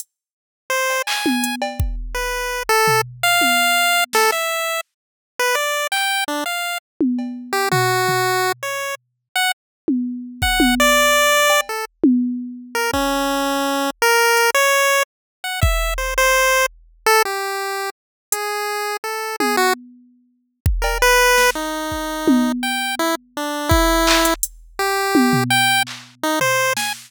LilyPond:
<<
  \new Staff \with { instrumentName = "Lead 1 (square)" } { \time 6/8 \tempo 4. = 111 r2 c''4 | gis''4. r4. | b'4. a'4 r8 | f''2~ f''8 a'8 |
e''4. r4. | b'8 d''4 g''4 d'8 | f''4 r2 | g'8 fis'2~ fis'8 |
cis''4 r4 fis''8 r8 | r2 fis''4 | d''2~ d''8 a'8 | r2 r8 ais'8 |
cis'2. | ais'4. cis''4. | r4 fis''8 e''4 c''8 | c''4. r4 a'8 |
g'2 r4 | gis'2 a'4 | gis'8 fis'8 r2 | r4 ais'8 b'4. |
dis'2. | g''4 e'8 r8 d'4 | e'2 r4 | g'2 g''4 |
r4 dis'8 c''4 gis''8 | }
  \new DrumStaff \with { instrumentName = "Drums" } \drummode { \time 6/8 hh4. r4 cb8 | hc8 tommh8 hh8 cb8 bd4 | r4. r8 tomfh4 | r8 tommh4 r4 sn8 |
r4. r4. | r4. hc4. | r4. tommh8 cb4 | r8 tomfh4 tomfh4. |
r4. r4. | r8 tommh4 r8 bd8 tommh8 | r4. r8 cb4 | r8 tommh4 r4. |
bd4. r4. | r4 hh8 r4. | r4. bd4. | r4. r4. |
r4. r4. | hh4. r4. | tommh4. r4. | r8 bd8 cb8 r4 sn8 |
r4 bd8 r8 tommh4 | r4. r4. | bd4 hc8 hh8 hh4 | r4 tommh8 tomfh4. |
hc4. tomfh4 sn8 | }
>>